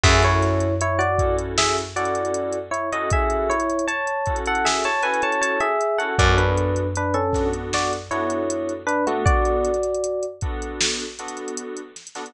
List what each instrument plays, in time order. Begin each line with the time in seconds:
0.04 electric bass (finger) F#2, electric piano 2 C#4 E4 F#4 A4, electric piano 1 G#4 E5, kick, crash
0.23 electric piano 1 E4 C#5, closed hi-hat
0.42 snare, closed hi-hat
0.60 closed hi-hat
0.81 electric piano 1 E4 C#5, closed hi-hat
0.99 electric piano 1 F#4 D5, closed hi-hat
1.18 electric piano 2 C#4 E4 F#4 A4, kick, closed hi-hat
1.38 closed hi-hat
1.58 electric piano 1 G#4 E5, snare
1.78 closed hi-hat
1.96 electric piano 2 C#4 E4 F#4 A4, electric piano 1 F#4 D5, closed hi-hat
2.05 closed hi-hat
2.15 closed hi-hat
2.25 closed hi-hat
2.34 closed hi-hat
2.53 closed hi-hat
2.71 electric piano 1 E4 C#5, closed hi-hat
2.92 electric piano 2 C#4 E4 F#4 A4, electric piano 1 D#5, closed hi-hat
3.10 electric piano 1 G#4 E5, kick, closed hi-hat
3.30 closed hi-hat
3.50 electric piano 1 E4 C#5, closed hi-hat
3.60 closed hi-hat
3.70 closed hi-hat
3.79 closed hi-hat
3.88 electric piano 1 C#5 A5, closed hi-hat
4.07 closed hi-hat
4.26 electric piano 2 C#4 E4 F#4 A4, kick, closed hi-hat
4.36 closed hi-hat
4.46 electric piano 1 A4 F#5, closed hi-hat
4.55 closed hi-hat
4.65 electric piano 1 G#4 E5, snare
4.84 electric piano 1 C#5 A5, closed hi-hat
5.03 electric piano 2 C#4 E4 F#4 A4, electric piano 1 B4 G#5, closed hi-hat
5.14 closed hi-hat
5.22 electric piano 1 C#5 A5, closed hi-hat
5.32 closed hi-hat
5.42 electric piano 1 C#5 A5, closed hi-hat
5.60 electric piano 1 G#4 E5, closed hi-hat
5.81 closed hi-hat
5.98 electric piano 2 C#4 E4 F#4 A4, electric piano 1 A4 F#5, closed hi-hat
6.18 electric bass (finger) F#2, electric piano 2 B3 D4 F#4 A4, electric piano 1 F#4 D5, kick, closed hi-hat
6.38 electric piano 1 D4 B4, closed hi-hat
6.57 closed hi-hat
6.76 closed hi-hat
6.96 electric piano 1 D4 B4, closed hi-hat
7.14 electric piano 1 C#4 A4, closed hi-hat
7.33 electric piano 2 B3 D4 F#4 A4, kick, snare, closed hi-hat
7.53 closed hi-hat
7.73 electric piano 1 F#4 D5, snare
7.93 closed hi-hat
8.11 electric piano 2 B3 D4 F#4 A4, electric piano 1 E4 C#5, closed hi-hat
8.30 closed hi-hat
8.50 closed hi-hat
8.69 closed hi-hat
8.87 electric piano 1 D4 B4, closed hi-hat
9.07 electric piano 1 A3 F#4, electric piano 2 B3 D4 F#4 A4, closed hi-hat
9.25 electric piano 1 F#4 D5, kick, closed hi-hat
9.45 closed hi-hat
9.65 closed hi-hat
9.74 closed hi-hat
9.83 closed hi-hat
9.94 closed hi-hat
10.04 closed hi-hat
10.23 closed hi-hat
10.41 electric piano 2 B3 D4 F#4 A4, kick, closed hi-hat
10.62 closed hi-hat
10.81 snare
11.00 closed hi-hat
11.19 electric piano 2 B3 D4 F#4 A4, closed hi-hat
11.28 closed hi-hat
11.37 closed hi-hat
11.48 closed hi-hat
11.57 closed hi-hat
11.77 closed hi-hat
11.96 snare, closed hi-hat
12.07 closed hi-hat
12.15 electric piano 2 B3 D4 F#4 A4, snare, closed hi-hat
12.26 closed hi-hat